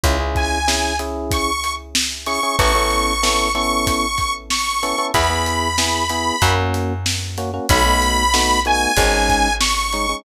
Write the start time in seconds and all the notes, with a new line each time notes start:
0.04 C#2 C#4 E4 G#4, kick, closed hi-hat
0.20 C#4 E4 G#4
0.35 G#5, kick, closed hi-hat
0.68 C#4 E4 G#4, snare
0.99 C#4 E4 G#4, closed hi-hat
1.31 C#6, kick, closed hi-hat
1.64 closed hi-hat
1.95 snare
2.26 C#4 E4 G#4 C#6, closed hi-hat
2.43 C#4 E4 G#4
2.59 A1 B3 C#4 E4 A4 C#6, kick, closed hi-hat
2.75 B3 C#4 E4 A4
2.91 closed hi-hat
3.23 B3 C#4 E4 A4, snare
3.55 B3 C#4 E4 A4 C#6, closed hi-hat
3.87 kick, closed hi-hat
4.18 kick, closed hi-hat
4.50 C#6, snare
4.83 B3 C#4 E4 A4, closed hi-hat
4.98 B3 C#4 E4 A4
5.14 E2 B3 E4 G#4 B5, kick, closed hi-hat
5.30 B3 E4 G#4
5.46 closed hi-hat
5.78 B3 E4 G#4, snare
6.09 B3 E4 G#4, closed hi-hat
6.42 F#2 A#3 C#4 F#4, kick, closed hi-hat
6.74 closed hi-hat
7.06 snare
7.38 A#3 C#4 F#4, closed hi-hat
7.54 A#3 C#4 F#4
7.69 B1 A3 B3 D#4 F#4 B5, kick, closed hi-hat
7.86 A3 B3 D#4 F#4
8.02 closed hi-hat
8.34 A3 B3 D#4 F#4, snare
8.65 A3 B3 D#4 F#4 G#5, closed hi-hat
8.97 G#1 G#3 C#4 D#4, kick, closed hi-hat
9.29 kick, closed hi-hat
9.61 C#6, snare
9.93 G#3 C#4 D#4, closed hi-hat
10.09 G#3 C#4 D#4